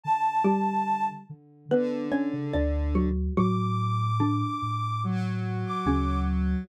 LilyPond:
<<
  \new Staff \with { instrumentName = "Ocarina" } { \time 4/4 \key d \major \tempo 4 = 72 a''4. r2 r8 | d'''2 r8. d'''8. r8 | }
  \new Staff \with { instrumentName = "Xylophone" } { \time 4/4 \key d \major r8 <g g'>4 r8 <b b'>8 <cis' cis''>16 r16 <d' d''>8 <fis fis'>8 | <fis fis'>4 <d d'>2 <cis cis'>4 | }
  \new Staff \with { instrumentName = "Lead 1 (square)" } { \clef bass \time 4/4 \key d \major r2 d2 | r2 fis2 | }
  \new Staff \with { instrumentName = "Ocarina" } { \clef bass \time 4/4 \key d \major d4. d8 d8 r16 cis16 d,4 | a,4. a,4. d,4 | }
>>